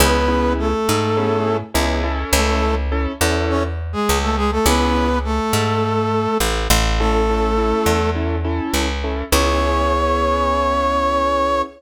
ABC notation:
X:1
M:4/4
L:1/16
Q:1/4=103
K:C#m
V:1 name="Brass Section"
[B,B]4 [A,A]8 z4 | [A,A]3 z5 [Cc] z2 [G,G]2 [A,A] [G,G] [A,A] | [B,B]4 [A,A]8 z4 | [A,A]8 z8 |
c16 |]
V:2 name="Acoustic Grand Piano"
[B,CEG]2 [B,CEG]6 [B,CEG]4 [B,CEG]2 [CEA]2- | [CEA]4 [CEA]2 [CEA]10 | [B,CEG]16 | [CEA]2 [CEA]2 [CEA]4 [CEA]2 [CEA]4 [CEA]2 |
[B,CEG]16 |]
V:3 name="Electric Bass (finger)" clef=bass
C,,6 G,,6 C,,4 | C,,6 E,,6 C,,4 | C,,6 G,,6 A,,,2 A,,,2- | A,,,6 E,,6 C,,4 |
C,,16 |]